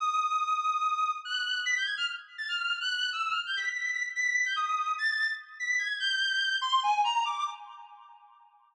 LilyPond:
\new Staff { \time 6/4 \tempo 4 = 145 ees'''2. ges'''4 b'''16 g'''16 aes'''16 f'''16 r8. a'''16 | f'''8. ges'''8. e'''8 \tuplet 3/2 { f'''8 g'''8 b'''8 } b'''8 b'''16 r16 b'''16 b'''8 g'''16 ees'''4 | a'''8. r8. b'''8 aes'''8 g'''4. c'''8 aes''8 bes''8 d'''8 | }